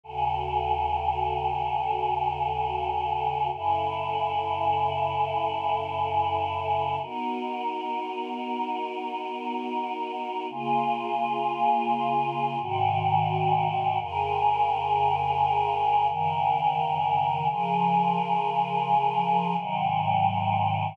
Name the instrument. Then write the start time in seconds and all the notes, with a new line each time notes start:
choir aahs
0.03 D#2 C#3 F#4 A4
3.53 F#2 C#3 E4 A4
7.01 B3 D#4 F#4 A#4
10.50 C#3 A#3 F4 G#4
12.60 G#2 C3 D#3 F#4
14.00 F2 C#3 G#4 A#4
16.09 F#2 C#3 D#3 A#4
17.48 C#3 F3 G#4 A#4
19.57 G#2 C3 D#3 F#3